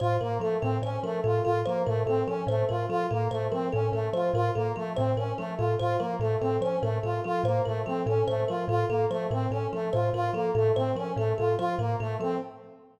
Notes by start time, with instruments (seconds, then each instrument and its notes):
0.00 kalimba A2 C5, brass section F4
0.21 kalimba A2 A#4, brass section A#3
0.40 kalimba F3 A4, brass section A3
0.61 kalimba A2 A4, brass section C4
0.82 kalimba A2 C5, brass section C#4
1.03 kalimba F3 A#4, brass section A3
1.24 kalimba A2 A4, brass section F4
1.44 kalimba A2 A4, brass section F4
1.66 kalimba F3 C5, brass section A#3
1.86 kalimba A2 A#4, brass section A3
2.06 kalimba A2 A4, brass section C4
2.27 kalimba F3 A4, brass section C#4
2.47 kalimba A2 C5, brass section A3
2.69 kalimba A2 A#4, brass section F4
2.89 kalimba F3 A4, brass section F4
3.11 kalimba A2 A4, brass section A#3
3.31 kalimba A2 C5, brass section A3
3.52 kalimba F3 A#4, brass section C4
3.72 kalimba A2 A4, brass section C#4
3.92 kalimba A2 A4, brass section A3
4.13 kalimba F3 C5, brass section F4
4.34 kalimba A2 A#4, brass section F4
4.55 kalimba A2 A4, brass section A#3
4.76 kalimba F3 A4, brass section A3
4.96 kalimba A2 C5, brass section C4
5.17 kalimba A2 A#4, brass section C#4
5.38 kalimba F3 A4, brass section A3
5.57 kalimba A2 A4, brass section F4
5.79 kalimba A2 C5, brass section F4
5.99 kalimba F3 A#4, brass section A#3
6.20 kalimba A2 A4, brass section A3
6.40 kalimba A2 A4, brass section C4
6.61 kalimba F3 C5, brass section C#4
6.82 kalimba A2 A#4, brass section A3
7.03 kalimba A2 A4, brass section F4
7.24 kalimba F3 A4, brass section F4
7.44 kalimba A2 C5, brass section A#3
7.65 kalimba A2 A#4, brass section A3
7.86 kalimba F3 A4, brass section C4
8.06 kalimba A2 A4, brass section C#4
8.28 kalimba A2 C5, brass section A3
8.48 kalimba F3 A#4, brass section F4
8.68 kalimba A2 A4, brass section F4
8.89 kalimba A2 A4, brass section A#3
9.11 kalimba F3 C5, brass section A3
9.31 kalimba A2 A#4, brass section C4
9.51 kalimba A2 A4, brass section C#4
9.73 kalimba F3 A4, brass section A3
9.93 kalimba A2 C5, brass section F4
10.13 kalimba A2 A#4, brass section F4
10.33 kalimba F3 A4, brass section A#3
10.55 kalimba A2 A4, brass section A3
10.76 kalimba A2 C5, brass section C4
10.96 kalimba F3 A#4, brass section C#4
11.17 kalimba A2 A4, brass section A3
11.38 kalimba A2 A4, brass section F4
11.58 kalimba F3 C5, brass section F4
11.79 kalimba A2 A#4, brass section A#3
12.00 kalimba A2 A4, brass section A3
12.20 kalimba F3 A4, brass section C4